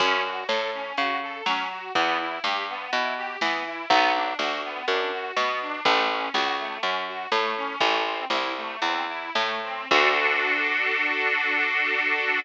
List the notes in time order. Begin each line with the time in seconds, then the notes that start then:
0.00 F#2 C#4, kick, crash
0.25 F#4
0.49 A2 A4, snare
0.73 C#4
0.97 C#3 F#4, closed hi-hat
1.22 A4
1.46 F#3 C#4, snare
1.70 F#4
1.95 E2 B3, kick, closed hi-hat
2.19 E4
2.44 G2 G4, snare
2.69 B3
2.92 B2 E4, closed hi-hat
3.17 G4
3.41 E3 B3, snare
3.66 E4
3.90 B1 B3, kick, closed hi-hat
4.14 D4
4.39 D2 F#4, snare
4.64 B3
4.88 F#2 D4, closed hi-hat
5.12 F#4
5.36 B2 B3, snare
5.61 D4
5.85 A1 A3, kick, closed hi-hat
6.10 C#4
6.34 C#2 F#4, snare
6.59 A3
6.83 F#2 C#4, closed hi-hat
7.07 F#4
7.32 A2 A3, snare
7.57 C#4
7.80 A1 A3, kick, closed hi-hat
8.05 C4
8.30 C2 E4, snare
8.56 A3
8.81 E2 C4, closed hi-hat
9.08 E4
9.35 A2 A3, snare
9.63 C4
9.91 D2 D4 F#4 A4, kick, crash